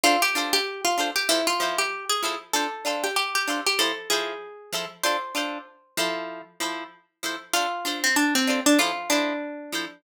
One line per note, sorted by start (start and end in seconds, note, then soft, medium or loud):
0.04 0.16 D4 loud
0.04 0.21 F4 loud
0.04 0.16 A4 loud
0.04 0.16 C5 loud
0.22 0.50 G4 loud
0.35 0.59 D4 loud
0.35 0.59 F4 loud
0.35 0.59 A4 loud
0.35 0.59 C5 loud
0.53 0.81 G4 loud
0.85 1.09 F4 medium
0.98 1.11 D4 medium
0.98 1.11 F4 medium
0.98 1.11 A4 loud
0.98 1.11 C5 medium
1.16 1.28 G4 loud
1.29 1.42 F3 loud
1.29 1.46 E4 loud
1.29 1.42 A4 loud
1.29 1.42 C5 loud
1.47 1.77 F4 loud
1.60 1.83 F3 loud
1.60 1.83 E4 medium
1.60 1.83 A4 medium
1.60 1.83 C5 medium
1.78 2.05 G4 medium
2.10 2.38 G#4 loud
2.23 2.36 F3 medium
2.23 2.36 E4 loud
2.23 2.36 A4 loud
2.23 2.36 C5 loud
2.53 2.67 D4 loud
2.53 2.67 F4 loud
2.53 2.96 A4 loud
2.53 2.67 C5 loud
2.85 3.08 D4 medium
2.85 3.08 F4 loud
2.85 3.08 A4 loud
2.85 3.08 C5 medium
3.04 3.16 G4 medium
3.16 3.34 G4 loud
3.35 3.64 G4 medium
3.48 3.60 D4 loud
3.48 3.60 F4 medium
3.48 3.60 A4 medium
3.48 3.60 C5 medium
3.67 3.79 G4 medium
3.79 3.92 F3 loud
3.79 3.92 E4 loud
3.79 4.09 A4 medium
3.79 3.92 C5 loud
4.10 4.34 F3 medium
4.10 4.34 E4 medium
4.10 4.91 G#4 medium
4.10 4.34 A4 loud
4.10 4.34 C5 medium
4.73 4.85 F3 medium
4.73 4.85 E4 loud
4.73 4.85 A4 loud
4.73 4.85 C5 loud
5.04 5.17 D4 loud
5.04 5.17 F4 loud
5.04 5.17 A4 loud
5.04 6.45 C5 loud
5.35 5.58 D4 loud
5.35 5.58 F4 loud
5.35 5.58 A4 loud
5.35 5.58 C5 medium
5.97 6.42 F3 loud
5.97 6.42 E4 loud
5.97 6.42 A4 loud
5.97 6.42 C5 loud
6.60 6.84 F3 loud
6.60 6.84 E4 medium
6.60 6.84 A4 loud
6.60 6.84 C5 medium
7.23 7.36 F3 medium
7.23 7.36 E4 loud
7.23 7.36 A4 medium
7.23 7.36 C5 loud
7.53 7.66 D4 loud
7.53 7.99 F4 loud
7.53 7.66 A4 loud
7.53 7.66 C5 loud
7.85 8.08 D4 loud
7.85 8.08 F4 loud
7.85 8.08 A4 loud
7.85 8.08 C5 medium
8.04 8.16 C4 loud
8.16 8.34 D4 loud
8.35 8.60 C4 medium
8.47 8.60 D4 loud
8.47 8.60 F4 medium
8.47 8.60 A4 medium
8.47 8.60 C5 loud
8.66 8.78 D4 loud
8.79 8.92 F3 loud
8.79 8.92 E4 loud
8.79 9.09 F4 loud
8.79 8.92 A4 loud
8.79 8.92 C5 loud
9.10 9.33 F3 loud
9.10 10.01 D4 medium
9.10 9.33 E4 loud
9.10 9.33 A4 medium
9.10 9.33 C5 loud
9.72 9.85 F3 medium
9.72 9.85 E4 medium
9.72 9.85 A4 medium
9.72 9.85 C5 loud